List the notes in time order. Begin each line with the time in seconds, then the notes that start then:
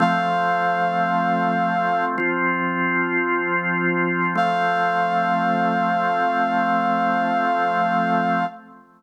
0.00 F3 A3 C4 F5
2.18 F3 C4 F4
4.35 F3 A3 C4 F5